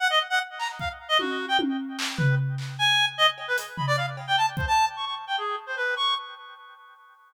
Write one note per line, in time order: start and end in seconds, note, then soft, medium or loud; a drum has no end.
0.00 0.08 F#5 loud
0.10 0.19 D#5 loud
0.30 0.39 F#5 loud
0.59 0.68 A#5 medium
0.59 clap medium
0.79 0.89 F5 medium
0.79 kick medium
1.09 1.18 D#5 loud
1.19 1.46 F#4 medium
1.19 high tom medium
1.48 1.57 G5 medium
1.59 high tom medium
1.99 clap loud
2.17 2.35 B4 medium
2.17 floor tom loud
2.58 clap medium
2.79 3.05 G#5 loud
3.18 3.27 D#5 loud
3.38 cowbell medium
3.48 3.57 B4 medium
3.58 closed hi-hat medium
3.77 3.86 B5 medium
3.77 floor tom medium
3.87 3.96 D5 loud
3.97 4.06 F5 medium
4.17 cowbell medium
4.27 4.36 G5 medium
4.37 4.46 A5 medium
4.57 4.66 C5 medium
4.57 kick medium
4.67 4.85 A5 loud
4.96 5.05 C#6 medium
5.05 5.14 C#6 medium
5.27 5.36 G5 medium
5.38 5.56 G#4 medium
5.67 5.75 C5 medium
5.77 5.95 B4 medium
5.97 6.14 C#6 medium